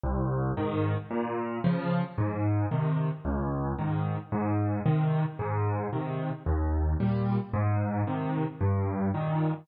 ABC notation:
X:1
M:4/4
L:1/8
Q:1/4=112
K:Ab
V:1 name="Acoustic Grand Piano" clef=bass
C,,2 [A,,E,]2 | B,,2 [D,F,]2 A,,2 [C,E,]2 | D,,2 [A,,E,]2 A,,2 [C,E,]2 | A,,2 [C,E,]2 E,,2 [B,,G,]2 |
A,,2 [C,E,]2 G,,2 [B,,E,]2 |]